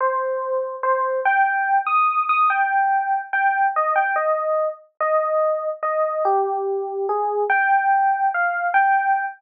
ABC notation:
X:1
M:6/8
L:1/8
Q:3/8=96
K:Cm
V:1 name="Electric Piano 1"
c4 c2 | g3 e'2 e' | g4 g2 | e g e3 z |
e4 e2 | G4 A2 | g4 f2 | g3 z3 |]